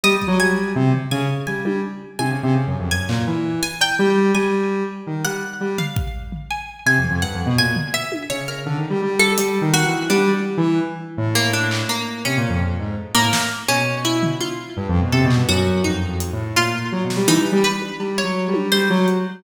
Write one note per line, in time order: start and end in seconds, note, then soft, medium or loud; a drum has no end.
0.04 0.14 G3 loud
0.04 0.36 D#5 loud
0.16 0.26 G3 soft
0.22 kick medium
0.27 0.38 F#3 loud
0.39 0.72 G3 medium
0.39 1.04 G#5 loud
0.76 0.92 C3 loud
0.93 floor tom medium
1.11 1.27 C#3 loud
1.11 1.44 G#5 medium
1.47 1.64 G3 medium
1.47 1.79 G#5 medium
1.47 floor tom medium
1.65 1.81 G3 medium
1.65 high tom loud
2.19 2.30 C3 medium
2.19 2.84 G#5 medium
2.19 high tom medium
2.31 2.42 C#3 medium
2.43 2.54 C3 loud
2.55 2.66 C#3 medium
2.67 2.78 F#2 medium
2.79 2.90 F2 medium
2.91 3.07 F#2 medium
2.91 3.56 G#5 loud
3.09 3.25 A#2 medium
3.09 clap medium
3.27 3.59 E3 medium
3.63 3.79 G#5 loud
3.81 3.97 G5 medium
3.81 cowbell loud
3.99 4.31 G3 loud
4.35 4.83 G3 medium
4.35 4.83 G#5 medium
5.07 5.23 D#3 medium
5.24 5.40 G3 medium
5.24 5.73 F#5 loud
5.60 5.77 G3 medium
5.78 6.27 F5 medium
5.78 floor tom loud
5.96 kick loud
6.32 floor tom medium
6.51 6.83 G#5 medium
6.86 6.97 C3 medium
6.86 7.19 G#5 medium
6.98 7.09 F2 soft
7.04 floor tom medium
7.10 7.21 F2 medium
7.22 7.33 G2 medium
7.22 7.54 F#5 medium
7.34 7.45 F2 medium
7.46 7.57 B2 loud
7.58 7.74 A#2 medium
7.58 7.91 G#5 loud
7.76 floor tom loud
7.94 8.26 E5 loud
8.12 high tom medium
8.30 8.62 C#3 medium
8.30 8.46 C#5 medium
8.48 8.64 A#4 soft
8.66 8.77 D3 medium
8.66 floor tom medium
8.78 8.89 D#3 medium
8.90 9.01 G3 medium
9.02 9.34 G3 medium
9.19 9.68 A4 loud
9.19 high tom medium
9.38 9.59 G3 medium
9.38 closed hi-hat loud
9.61 9.83 D#3 medium
9.74 10.06 F#4 loud
9.86 10.07 E3 medium
10.10 10.31 G3 loud
10.10 10.42 D4 medium
10.34 10.55 G3 medium
10.57 10.79 E3 loud
11.17 11.82 A2 medium
11.35 11.51 A#3 loud
11.53 11.86 D4 medium
11.71 clap loud
11.89 12.21 A#3 medium
12.25 12.36 C3 medium
12.25 12.90 C#4 medium
12.37 12.48 A#2 medium
12.49 12.60 F2 medium
12.61 12.77 F2 medium
12.79 12.95 G#2 medium
13.15 13.31 A2 medium
13.15 13.47 A#3 loud
13.33 snare loud
13.68 14.33 B2 medium
13.68 14.01 C#4 loud
14.05 14.37 E4 medium
14.23 floor tom loud
14.41 14.89 F4 medium
14.41 high tom medium
14.77 14.87 G2 medium
14.89 15.00 F2 loud
14.95 floor tom medium
15.01 15.12 B2 medium
15.12 15.23 C3 loud
15.12 15.45 A4 medium
15.24 15.35 B2 loud
15.31 clap medium
15.36 15.47 G2 medium
15.49 15.81 F#2 loud
15.49 15.81 F#4 loud
15.84 16.06 F2 medium
15.84 16.33 D#4 medium
16.09 16.30 F2 medium
16.20 closed hi-hat medium
16.33 16.54 A2 medium
16.56 16.89 A#2 medium
16.56 16.89 F4 medium
16.92 17.03 F#3 medium
17.04 17.15 B2 medium
17.10 snare medium
17.16 17.27 G3 medium
17.28 17.39 E3 loud
17.28 17.60 D#4 loud
17.40 17.51 G3 medium
17.52 17.63 G3 loud
17.64 17.96 B4 medium
17.82 high tom medium
18.00 18.21 G3 medium
18.00 cowbell medium
18.18 18.67 C#5 medium
18.24 18.45 F#3 medium
18.48 18.70 G3 medium
18.54 high tom loud
18.72 18.88 G3 medium
18.72 19.04 C5 loud
18.72 clap medium
18.90 19.06 F#3 loud
19.08 closed hi-hat medium